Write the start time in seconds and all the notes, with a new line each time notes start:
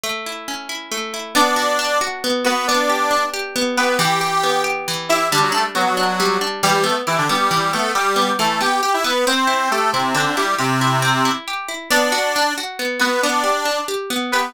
0.03 A3
0.26 E4
0.48 C#4
0.69 E4
0.91 A3
1.14 E4
1.35 B3 D4 D5
1.56 F#4
1.79 D4
2.01 F#4
2.24 B3
2.45 B3 F#4 B4
2.67 B3 D4 D5
2.90 G4
3.11 D4
3.34 G4
3.56 B3
3.77 B3 G4 B4
3.99 E3 G4 G5
4.21 G4
4.43 B3
4.64 G4
4.88 E3
5.09 E4 G4 E5
5.31 D3 G3 D4
5.42 F#3 F#4
5.52 A3 D4 A4
5.75 F#3 B3 F#4
5.86 F#3 F#4
5.97 D4
6.20 G3
6.41 D4
6.63 E3 G3 G4
6.74 G3 G4
6.84 A3 B3 A4
7.07 E3 E4 G4
7.18 D3 D4
7.29 G3 B3 G4
7.51 E3
7.73 A3 B3 A4
7.95 G3 G4
8.16 B3
8.39 E3 A3 A4
8.61 B3 G4 G5
8.83 G4 G5
8.94 E4 E5
9.04 B3 B4
9.27 C4 C5
9.47 E4
9.71 A3 G4 A4
9.93 C3 C4 E4
10.14 D3 C4 D4
10.26 D3 D4
10.37 G3 E4 G4
10.59 C3 C4 G4
10.81 E4
11.02 C4
11.25 E4
11.48 G4
11.68 E4
11.90 B3 D4 D5
12.12 F#4
12.36 D4
12.58 F#4
12.79 B3
13.00 B3 F#4 B4
13.22 B3 D4 D5
13.44 G4
13.65 D4
13.88 G4
14.10 B3
14.32 B3 G4 B4